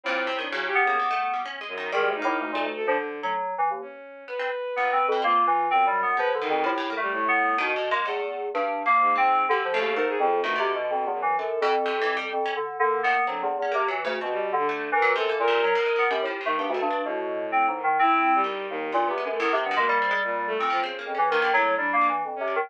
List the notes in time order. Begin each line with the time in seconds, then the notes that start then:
0.03 A2 A#2 C4
0.27 C3
0.38 D#3 D4
0.51 C#3 F#3
0.67 G4
0.75 B3
0.84 C#3 A#3
1.00 E3
1.11 A3
1.34 G3
1.45 C#4
1.61 G#3
1.68 F#2
1.78 D#3
1.92 D#3 G3 G#3
2.08 D2
2.15 D#4
2.22 A2 A#3
2.40 D2
2.52 A#2 A3
2.64 D2
2.76 A4
2.86 D3 F3
2.99 D3
3.22 F#3 A3 C#4
3.58 E3
3.70 D#2
3.81 C#4
4.28 B3 B4
4.39 C4
4.76 A#2 B3
4.92 C4
5.08 F2
5.12 B2
5.22 A#3 C4 F4
5.47 E3
5.70 F#2 C4
5.86 G3
6.02 B3
6.17 C#3 F3 B4
6.34 D3
6.41 B2 D#3
6.49 F2
6.64 A2 F3 G4
6.78 C#3
6.88 A3 A#3
6.97 A3
7.01 G3
7.12 A2
7.28 B3
7.58 B2 D#3
7.75 A2 B2
7.91 G#3 A#3
8.05 E2 A2
8.54 G2 G3
8.86 F3 A#3
9.01 G#2
9.16 F3 C4
9.49 B2 D3 G4
9.64 F3
9.72 C#3 A3
9.80 D#2
9.95 G#2 A3 A#4
10.09 G#4
10.19 F2 F3
10.43 B2 D#3 A3
10.56 C3 D3
10.75 B2
10.90 F2
11.06 E2
11.13 F#2
11.22 E3
11.37 F#2 A3 A4
11.61 F2 B2
11.86 C3
12.01 E3
12.17 G3
12.32 F2
12.46 C#4
12.56 D3
12.79 D3 A#3
13.03 A2 B3
13.27 D3 F#3 C4
13.42 E2
13.58 E2
13.62 C#4
13.72 C3 A#3
13.88 E3 F#3
14.05 D2 C#3
14.21 B2 B3 C4
14.32 G3
14.37 B2
14.53 D3
14.57 D3
14.69 A3
14.92 E3 A#4
15.02 F#3
15.16 F#2 C3 A4
15.29 A#3
15.39 A#2 A#4
15.48 C3
15.63 F#3 C#4
15.75 B2
15.86 G#3
15.96 F3 B3
16.09 F#2 G3 G4
16.22 A2 F3
16.41 C3
16.45 D#3 A3
16.57 G2 G3 B3
16.69 D2 B2
16.74 A3
16.81 G2
16.90 D4
17.04 A2 B2
17.52 C4
17.68 G#2
17.76 D#3
17.83 D#3
17.99 C4 E4
18.35 G3
18.44 D#3
18.70 D#2 D#3
18.92 A#2 D3
19.05 C3 B3
19.18 G#3
19.25 F#2
19.30 A3
19.40 A2 B3 A#4
19.53 C3 C4
19.63 G2 B3
19.71 B2
19.76 G#3 A#3
19.88 G3 C#4
20.02 C4
20.11 G#3
20.24 A#2
20.47 A3
20.59 A#2 C4
20.70 A#2 F3
20.82 C#3 C4
20.99 A#3
21.06 F2
21.15 E3 C#4
21.29 D#3 A#3
21.42 D3
21.53 A2 D3 F#3
21.77 G3 D4
21.93 A#3
22.01 A#3
22.09 E3
22.24 F2
22.36 C3 C#4
22.48 D4
22.56 D#3